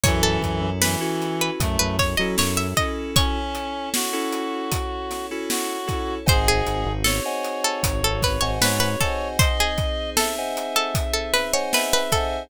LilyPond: <<
  \new Staff \with { instrumentName = "Pizzicato Strings" } { \time 4/4 \key cis \minor \tempo 4 = 77 cis''16 a'8. b'16 r8 b'8 b'16 cis''16 dis''16 cis''16 e''16 dis''8 | cis''2~ cis''8 r4. | bis'16 gis'8. a'16 r8 a'8 a'16 b'16 cis''16 b'16 b'16 a'8 | bis'16 gis'8. a'16 r8 a'8 a'16 b'16 cis''16 b'16 b'16 a'8 | }
  \new Staff \with { instrumentName = "Clarinet" } { \time 4/4 \key cis \minor e4 e4 a8 r4. | cis'4 fis'2 fis'4 | gis'4 cis''2 cis''4 | dis''4 e''2 e''4 | }
  \new Staff \with { instrumentName = "Electric Piano 2" } { \time 4/4 \key cis \minor <cis' e' fis' a'>4~ <cis' e' fis' a'>16 <cis' e' fis' a'>4. <cis' e' fis' a'>8. <cis' e' fis' a'>8~ | <cis' e' fis' a'>4~ <cis' e' fis' a'>16 <cis' e' fis' a'>4. <cis' e' fis' a'>8. <cis' e' fis' a'>8 | <bis' dis'' fis'' gis''>4~ <bis' dis'' fis'' gis''>16 <bis' dis'' fis'' gis''>4. <bis' dis'' fis'' gis''>8. <bis' dis'' fis'' gis''>8~ | <bis' dis'' fis'' gis''>4~ <bis' dis'' fis'' gis''>16 <bis' dis'' fis'' gis''>4. <bis' dis'' fis'' gis''>8. <bis' dis'' fis'' gis''>8 | }
  \new Staff \with { instrumentName = "Synth Bass 1" } { \clef bass \time 4/4 \key cis \minor fis,8 fis,16 fis,4~ fis,16 fis,16 fis,8 fis16 fis,4~ | fis,1 | gis,,8 gis,,16 gis,,4~ gis,,16 gis,,16 gis,,8 gis,,16 gis,4~ | gis,1 | }
  \new Staff \with { instrumentName = "Pad 5 (bowed)" } { \time 4/4 \key cis \minor <cis' e' fis' a'>1 | <cis' e' a' cis''>1 | <bis dis' fis' gis'>1 | <bis dis' gis' bis'>1 | }
  \new DrumStaff \with { instrumentName = "Drums" } \drummode { \time 4/4 <hh bd>8 <hh bd>8 sn8 hh8 <hh bd>8 <hh bd sn>8 sn8 <hh bd>8 | <hh bd>8 hh8 sn8 hh8 <hh bd>8 <hh sn>8 sn8 <hh bd>8 | <hh bd>8 hh8 sn8 hh8 <hh bd>8 <hh bd sn>8 sn8 <hh bd>8 | <hh bd>8 <hh bd>8 sn8 hh8 <hh bd>8 <hh sn>8 sn8 <hh bd sn>8 | }
>>